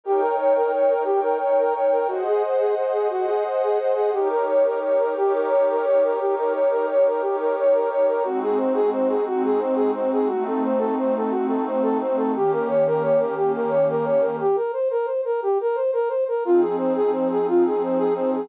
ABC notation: X:1
M:12/8
L:1/8
Q:3/8=117
K:Eb
V:1 name="Brass Section"
G B _d B d B G B d B d B | _G A c A c A G A c A c A | G B _d B d B G B d B d B | G B _d B d B G B d B d B |
_G A c A c A G A c A c A | _G =A c A c A G A c A c A | G B _d B d B G B d B d B | G B c B c B G B c B c B |
F A c A c A F A c A c A |]
V:2 name="Pad 5 (bowed)"
[EB_dg]6 [EBdg]6 | [Ace_g]6 [Aceg]6 | [EGB_d]6 [EGBd]6 | [EGB_d]6 [EGBd]6 |
[A,CE_G]6 [A,CEG]6 | [=A,CE_G]6 [A,CEG]6 | [E,B,_DG]6 [E,B,DG]6 | z12 |
[F,CEA]6 [F,CEA]6 |]